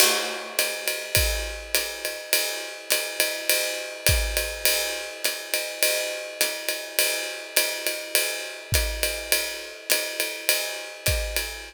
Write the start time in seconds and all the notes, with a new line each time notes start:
0.00 crash, ride
0.59 hi-hat pedal, ride
0.88 ride
1.15 kick, ride
1.75 hi-hat pedal, ride
2.05 ride
2.33 ride
2.90 hi-hat pedal, ride
3.20 ride
3.50 ride
4.06 kick, hi-hat pedal, ride
4.37 ride
4.65 ride
5.25 hi-hat pedal, ride
5.54 ride
5.83 ride
6.41 hi-hat pedal, ride
6.69 ride
6.99 ride
7.56 hi-hat pedal, ride
7.87 ride
8.15 ride
8.72 kick, hi-hat pedal, ride
9.03 ride
9.32 ride
9.90 hi-hat pedal, ride
10.20 ride
10.49 ride
11.06 kick, hi-hat pedal, ride
11.36 ride